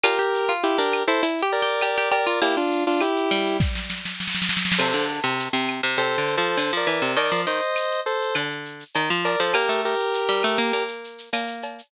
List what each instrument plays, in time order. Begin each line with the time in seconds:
0.03 pizzicato strings F4, lead 1 (square) G4 A#4, cowbell, claves, shaker
0.19 pizzicato strings G4, shaker
0.34 shaker
0.49 pizzicato strings F4, shaker
0.63 lead 1 (square) E4 G4, shaker
0.78 pizzicato strings D4, lead 1 (square) G4 A#4, shaker
0.92 claves, shaker
1.07 pizzicato strings E4, lead 1 (square) A4 C5, shaker
1.23 pizzicato strings E4, cowbell, shaker
1.38 shaker
1.42 pizzicato strings G4
1.52 lead 1 (square) A#4 D5, shaker
1.62 pizzicato strings G4
1.67 shaker
1.81 pizzicato strings G4, cowbell, claves, shaker
1.96 pizzicato strings G4, shaker
2.11 pizzicato strings G4, lead 1 (square) A#4 D5, cowbell, shaker
2.26 pizzicato strings F4, shaker
2.41 pizzicato strings A#3, lead 1 (square) E4 G4, cowbell, shaker
2.56 lead 1 (square) D4 F4, shaker
2.71 shaker
2.87 lead 1 (square) D4 F4, shaker
3.00 lead 1 (square) E4 G4, claves, shaker
3.16 shaker
3.30 pizzicato strings G3, shaker
3.46 shaker
3.60 kick, snare
3.75 snare
3.90 snare
4.05 snare
4.20 snare
4.28 snare
4.35 snare
4.42 snare
4.49 snare
4.57 snare
4.65 snare
4.72 snare
4.78 pizzicato strings C3, lead 1 (square) A4 C5, crash, cowbell, claves
4.94 pizzicato strings D3, shaker
5.08 shaker
5.23 pizzicato strings C3, shaker
5.39 shaker
5.53 pizzicato strings C3, shaker
5.69 claves, shaker
5.83 pizzicato strings C3, shaker
5.97 pizzicato strings C3, lead 1 (square) A4 C5, cowbell, shaker
6.13 shaker
6.18 pizzicato strings D3
6.28 shaker
6.37 pizzicato strings F3, lead 1 (square) A4 C5
6.42 shaker
6.57 pizzicato strings D3, cowbell, claves, shaker
6.72 pizzicato strings F3, shaker
6.77 lead 1 (square) A#4 D5
6.87 pizzicato strings E3, cowbell, shaker
7.02 pizzicato strings C3, shaker
7.16 pizzicato strings D#3, lead 1 (square) A#4 D5, cowbell, shaker
7.31 pizzicato strings F3, shaker
7.47 pizzicato strings D#3, lead 1 (square) C5 D#5, shaker
7.62 shaker
7.76 claves, shaker
7.91 shaker
8.06 lead 1 (square) A4 C5, shaker
8.21 shaker
8.35 pizzicato strings D3, cowbell, claves, shaker
8.50 shaker
8.65 shaker
8.80 shaker
8.94 pizzicato strings D#3, cowbell, shaker
9.10 pizzicato strings F3, shaker
9.25 lead 1 (square) A#4 D5, cowbell, shaker
9.40 pizzicato strings F3, lead 1 (square) A4 C5, shaker
9.53 pizzicato strings A#3, lead 1 (square) G4 A#4, cowbell, claves, shaker
9.69 pizzicato strings A3, shaker
9.85 lead 1 (square) G4 A#4, shaker
9.99 shaker
10.14 shaker
10.29 pizzicato strings G3, shaker
10.43 pizzicato strings A3, claves, shaker
10.58 pizzicato strings A#3, shaker
10.73 pizzicato strings A#3, cowbell, shaker
10.88 shaker
11.04 shaker
11.18 shaker
11.33 pizzicato strings A#3, cowbell, claves, shaker
11.47 shaker
11.62 cowbell, shaker
11.78 shaker